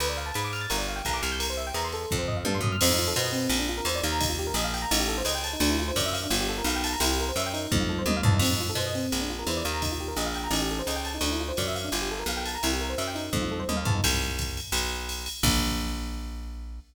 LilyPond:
<<
  \new Staff \with { instrumentName = "Electric Piano 1" } { \time 4/4 \key bes \major \tempo 4 = 171 b'16 d''16 f''16 a''16 b''16 d'''16 f'''16 a'''16 bes'16 d''16 f''16 g''16 bes''16 d'''16 f'''16 g'''16 | bes'16 c''16 e''16 g''16 bes''16 c'''16 a'8. c''16 ees''16 f''16 a''16 c'''16 ees'''16 f'''16 | c'16 ees'16 f'16 a'16 c''16 ees''16 c'8. d'16 f'16 bes'16 c''16 d''16 f''16 bes''16 | ees'16 f'16 g'16 bes'16 ees''16 f''16 g''16 bes''16 ees'16 g'16 a'16 c''16 ees''16 g''16 a''16 ees'16 |
d'16 e'16 f'16 c''16 d''16 e''16 f''16 d'16 f'16 g'16 a'16 bes'16 f''16 g''16 a''16 bes''16 | e'16 g'16 bes'16 c''16 e''16 g''16 ees'8. f'16 a'16 c''16 ees''16 f''16 a''16 ees'16 | c'16 ees'16 f'16 a'16 c''16 ees''16 c'8. d'16 f'16 bes'16 c''16 d''16 f''16 bes''16 | ees'16 f'16 g'16 bes'16 ees''16 f''16 g''16 bes''16 ees'16 g'16 a'16 c''16 ees''16 g''16 a''16 ees'16 |
d'16 e'16 f'16 c''16 d''16 e''16 f''16 d'16 f'16 g'16 a'16 bes'16 f''16 g''16 a''16 bes''16 | e'16 g'16 bes'16 c''16 e''16 g''16 ees'8. f'16 a'16 c''16 ees''16 f''16 a''16 ees'16 | r1 | r1 | }
  \new Staff \with { instrumentName = "Electric Bass (finger)" } { \clef bass \time 4/4 \key bes \major d,4 aes,4 g,,4 b,,8 c,8~ | c,4 e,4 f,4 g,8 ges,8 | f,4 b,4 bes,,4 e,8 ees,8~ | ees,4 bes,,4 a,,4 des,4 |
d,4 ges,4 g,,4 b,,4 | c,4 ges,4 f,4 ees,8 e,8 | f,4 b,4 bes,,4 e,8 ees,8~ | ees,4 bes,,4 a,,4 des,4 |
d,4 ges,4 g,,4 b,,4 | c,4 ges,4 f,4 ees,8 e,8 | c,2 b,,2 | bes,,1 | }
  \new DrumStaff \with { instrumentName = "Drums" } \drummode { \time 4/4 cymr4 <hhp cymr>8 cymr8 cymr4 <hhp bd cymr>8 cymr8 | cymr4 <hhp cymr>8 cymr8 bd8 tomfh8 tommh8 tomfh8 | <cymc cymr>4 <hhp cymr>8 cymr8 cymr4 <hhp cymr>8 cymr8 | <bd cymr>4 <hhp cymr>8 cymr8 cymr4 <hhp cymr>8 cymr8 |
cymr4 <hhp bd cymr>8 cymr8 cymr4 <hhp cymr>8 cymr8 | cymr4 <hhp cymr>8 cymr8 <bd tommh>4 tommh8 tomfh8 | <cymc cymr>4 <hhp cymr>8 cymr8 cymr4 <hhp cymr>8 cymr8 | <bd cymr>4 <hhp cymr>8 cymr8 cymr4 <hhp cymr>8 cymr8 |
cymr4 <hhp bd cymr>8 cymr8 cymr4 <hhp cymr>8 cymr8 | cymr4 <hhp cymr>8 cymr8 <bd tommh>4 tommh8 tomfh8 | <bd cymr>4 <hhp bd cymr>8 cymr8 cymr4 <hhp cymr>8 cymr8 | <cymc bd>4 r4 r4 r4 | }
>>